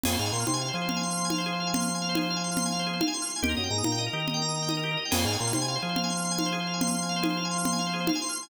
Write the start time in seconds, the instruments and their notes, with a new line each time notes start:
0.04 drawbar organ F2 G#4, crash, low conga
0.12 drawbar organ C5
0.19 drawbar organ G#2 F5
0.26 drawbar organ G#5
0.33 drawbar organ A#2 C6
0.40 drawbar organ F6
0.47 drawbar organ C3 C6, high conga
0.54 drawbar organ G#5
0.61 drawbar organ F5
0.68 drawbar organ C5
0.74 drawbar organ F3 G#4
0.82 drawbar organ C5
0.89 drawbar organ F5, low conga
0.97 drawbar organ G#5
1.03 drawbar organ C6
1.11 drawbar organ F6
1.17 drawbar organ C6
1.25 drawbar organ G#5
1.30 drawbar organ F5, high conga
1.38 drawbar organ C5
1.46 drawbar organ G#4
1.53 drawbar organ C5
1.60 drawbar organ F5
1.67 drawbar organ G#5
1.74 drawbar organ C6, low conga
1.80 drawbar organ F6
1.88 drawbar organ C6
1.94 drawbar organ G#5
2.02 drawbar organ F5
2.09 drawbar organ C5
2.15 drawbar organ G#4, high conga
2.23 drawbar organ C5
2.30 drawbar organ F5
2.36 drawbar organ G#5
2.44 drawbar organ C6
2.52 drawbar organ F6
2.57 drawbar organ C6, low conga
2.66 drawbar organ G#5
2.72 drawbar organ F5
2.79 drawbar organ C5
2.87 drawbar organ G#4
2.93 drawbar organ C5
3.01 drawbar organ F5, high conga
3.08 drawbar organ G#5
3.14 drawbar organ C6
3.22 drawbar organ F6
3.29 drawbar organ C6
3.36 drawbar organ G#5
3.42 drawbar organ D#2 G4, low conga
3.49 drawbar organ A#4
3.57 drawbar organ F#2 D#5
3.64 drawbar organ G5
3.71 drawbar organ G#2 A#5
3.78 drawbar organ D#6
3.84 drawbar organ A#2 A#5, high conga
3.92 drawbar organ G5
3.98 drawbar organ D#5
4.06 drawbar organ A#4
4.13 drawbar organ D#3 G4
4.20 drawbar organ A#4
4.27 drawbar organ D#5, low conga
4.34 drawbar organ G5
4.42 drawbar organ A#5
4.49 drawbar organ D#6
4.56 drawbar organ A#5
4.62 drawbar organ G5
4.69 drawbar organ D#5, high conga
4.77 drawbar organ A#4
4.83 drawbar organ G4
4.91 drawbar organ A#4
4.97 drawbar organ D#5
5.05 drawbar organ G5
5.11 drawbar organ F2 G#4, crash, low conga
5.18 drawbar organ C5
5.25 drawbar organ G#2 F5
5.33 drawbar organ G#5
5.40 drawbar organ A#2 C6
5.47 drawbar organ F6
5.53 drawbar organ C3 C6, high conga
5.62 drawbar organ G#5
5.68 drawbar organ F5
5.76 drawbar organ C5
5.82 drawbar organ F3 G#4
5.89 drawbar organ C5
5.96 drawbar organ F5, low conga
6.04 drawbar organ G#5
6.10 drawbar organ C6
6.17 drawbar organ F6
6.25 drawbar organ C6
6.31 drawbar organ G#5
6.38 drawbar organ F5, high conga
6.46 drawbar organ C5
6.52 drawbar organ G#4
6.60 drawbar organ C5
6.67 drawbar organ F5
6.74 drawbar organ G#5
6.81 drawbar organ C6, low conga
6.88 drawbar organ F6
6.94 drawbar organ C6
7.02 drawbar organ G#5
7.09 drawbar organ F5
7.16 drawbar organ C5
7.22 drawbar organ G#4, high conga
7.30 drawbar organ C5
7.37 drawbar organ F5
7.45 drawbar organ G#5
7.51 drawbar organ C6
7.58 drawbar organ F6
7.65 drawbar organ C6, low conga
7.72 drawbar organ G#5
7.79 drawbar organ F5
7.87 drawbar organ C5
7.93 drawbar organ G#4
8.00 drawbar organ C5
8.07 drawbar organ F5, high conga
8.15 drawbar organ G#5
8.22 drawbar organ C6
8.29 drawbar organ F6
8.36 drawbar organ C6
8.43 drawbar organ G#5